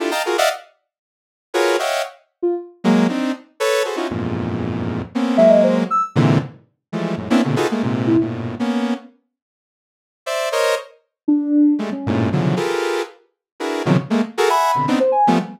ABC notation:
X:1
M:2/4
L:1/16
Q:1/4=117
K:none
V:1 name="Lead 2 (sawtooth)"
[DEFGA] [^dfga^a] [F^F^G^A] [=d^de=f^f] z4 | z4 [F^F^G^AB^c]2 [c^de=f^f=g]2 | z6 [^F,^G,^A,]2 | [CD^D]2 z2 [AB^c]2 [^F^GAB=c] [^CDE=F^F] |
[E,,F,,G,,^G,,^A,,]8 | [^A,B,C^C]2 [^F,^G,A,]4 z2 | [^G,,^A,,C,D,E,]2 z4 [E,F,=G,^G,=A,]2 | [^F,,^G,,A,,] [^A,B,C^CDE] [^A,,B,,=C,^C,D,] [^D=F^F^G=AB] [^G,=A,^A,] [G,,A,,=C,]3 |
[G,,A,,^A,,B,,]3 [^A,B,^C]3 z2 | z8 | [cde]2 [^Ac^c^d]2 z4 | z4 [G,^G,A,] z [=G,,^G,,A,,^A,,]2 |
[B,,^C,D,E,F,^F,]2 [=FG^GA^AB]4 z2 | z2 [DE^F^G^AB]2 [B,,C,^C,^D,=F,^F,] z [^G,=A,^A,] z | [^F^GA^A] [e^f^g]2 [B,,C,D,] [B,CD^D] z2 [=F,=G,=A,B,] |]
V:2 name="Ocarina"
z8 | z8 | z3 F z4 | z8 |
z8 | z2 e ^d c z e' z | z8 | z7 E |
z8 | z8 | z8 | D4 z ^C3 |
z8 | z8 | z b3 z c ^g2 |]